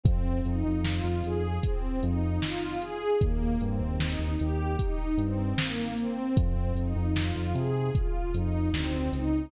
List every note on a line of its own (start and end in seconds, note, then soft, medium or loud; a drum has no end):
0.03 0.40 F2 loud
0.03 0.39 C4 loud
0.03 kick loud
0.03 closed hi-hat medium
0.44 0.63 F2 loud
0.44 0.79 D#4 medium
0.44 closed hi-hat medium
0.64 1.00 F2 loud
0.84 1.19 F4 medium
0.84 snare loud
1.04 1.22 F2 medium
1.23 1.59 F2 medium
1.23 1.58 G#4 medium
1.23 closed hi-hat medium
1.63 1.99 C4 medium
1.63 kick medium
1.63 closed hi-hat loud
2.03 2.38 F2 loud
2.03 2.39 D#4 medium
2.03 closed hi-hat medium
2.42 2.78 F4 medium
2.42 snare loud
2.80 3.16 G#4 medium
2.80 closed hi-hat medium
3.21 3.57 D#2 loud
3.21 3.57 A#3 loud
3.21 kick loud
3.21 closed hi-hat medium
3.61 3.79 G2 loud
3.61 3.97 C4 medium
3.61 closed hi-hat medium
3.80 4.15 D#2 medium
3.98 4.34 D#4 medium
3.98 snare loud
4.19 4.37 D#2 medium
4.40 4.76 D#2 medium
4.40 4.77 G4 medium
4.40 closed hi-hat medium
4.79 5.15 D#4 medium
4.79 kick medium
4.79 closed hi-hat loud
5.18 5.53 G2 medium
5.18 5.55 C4 medium
5.18 closed hi-hat medium
5.58 5.94 A#3 medium
5.58 snare loud
5.98 6.34 C4 medium
5.98 closed hi-hat medium
6.37 6.72 F2 loud
6.37 6.73 C4 medium
6.37 kick loud
6.37 closed hi-hat loud
6.75 6.93 F2 medium
6.75 7.13 D#4 medium
6.75 closed hi-hat medium
6.96 7.31 F2 loud
7.15 7.51 F4 medium
7.15 snare loud
7.36 7.53 F2 medium
7.54 7.90 C3 medium
7.54 7.90 G#4 medium
7.54 closed hi-hat medium
7.94 8.30 F4 medium
7.94 kick medium
7.94 closed hi-hat medium
8.34 8.70 F2 medium
8.34 8.70 D#4 medium
8.34 closed hi-hat medium
8.73 9.09 D2 medium
8.73 9.10 C4 medium
8.73 snare loud
9.13 9.48 C#2 medium
9.13 9.49 D#4 medium
9.13 closed hi-hat medium